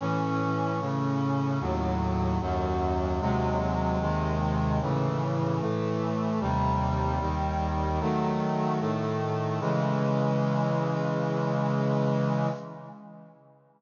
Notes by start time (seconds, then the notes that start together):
0.01 A2 E3 C#4
0.80 A2 C#3 C#4
1.60 D#2 A2 F#3
2.41 D#2 F#2 F#3
3.20 D#2 C3 F#3 G#3
4.00 D#2 C3 D#3 G#3
4.81 A2 C#3 E3
5.60 A2 E3 A3
6.40 D#2 C3 G3
7.20 D#2 D#3 G3
8.00 D#3 F#3 A3
8.80 A2 D#3 A3
9.60 C#3 E3 G#3